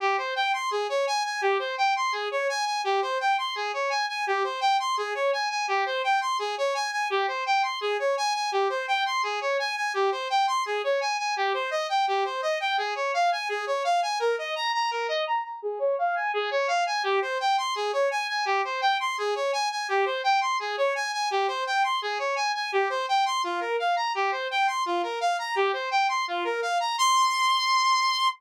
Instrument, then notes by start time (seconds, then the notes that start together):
lead 2 (sawtooth)
0.00 G4
0.18 C5
0.36 G5
0.53 C6
0.71 G#4
0.89 C#5
1.07 G#5
1.25 G#5
1.41 G4
1.59 C5
1.78 G5
1.96 C6
2.12 G#4
2.31 C#5
2.49 G#5
2.65 G#5
2.84 G4
3.02 C5
3.20 G5
3.38 C6
3.55 G#4
3.73 C#5
3.90 G#5
4.09 G#5
4.27 G4
4.44 C5
4.61 G5
4.80 C6
4.97 G#4
5.15 C#5
5.33 G#5
5.50 G#5
5.68 G4
5.86 C5
6.04 G5
6.21 C6
6.39 G#4
6.58 C#5
6.74 G#5
6.92 G#5
7.10 G4
7.28 C5
7.46 G5
7.63 C6
7.81 G#4
7.99 C#5
8.17 G#5
8.34 G#5
8.52 G4
8.69 C5
8.88 G5
9.06 C6
9.23 G#4
9.41 C#5
9.59 G#5
9.76 G#5
9.94 G4
10.12 C5
10.30 G5
10.47 C6
10.66 G#4
10.84 C#5
11.01 G#5
11.18 G#5
11.36 G4
11.54 C5
11.71 D#5
11.89 G5
12.07 G4
12.25 C5
12.42 D#5
12.60 G5
12.78 G#4
12.95 C#5
13.14 F5
13.32 G#5
13.49 G#4
13.67 C#5
13.84 F5
14.02 G#5
14.19 A#4
14.38 D#5
14.55 A#5
14.74 A#5
14.91 A#4
15.08 D#5
15.27 A#5
15.44 A#5
15.62 G#4
15.79 C#5
15.99 F5
16.15 G#5
16.34 G#4
16.51 C#5
16.68 F5
16.86 G#5
17.03 G4
17.22 C5
17.40 G5
17.58 C6
17.75 G#4
17.93 C#5
18.11 G#5
18.28 G#5
18.45 G4
18.64 C5
18.81 G5
19.00 C6
19.18 G#4
19.35 C#5
19.53 G#5
19.71 G#5
19.88 G4
20.05 C5
20.24 G5
20.41 C6
20.60 G#4
20.77 C#5
20.95 G#5
21.13 G#5
21.31 G4
21.48 C5
21.66 G5
21.84 C6
22.02 G#4
22.19 C#5
22.36 G#5
22.55 G#5
22.72 G4
22.90 C5
23.08 G5
23.25 C6
23.44 F4
23.60 A#4
23.79 F5
23.96 A#5
24.15 G4
24.31 C5
24.51 G5
24.67 C6
24.86 F4
25.03 A#4
25.21 F5
25.39 A#5
25.55 G4
25.73 C5
25.91 G5
26.09 C6
26.28 F4
26.44 A#4
26.62 F5
26.80 A#5
26.98 C6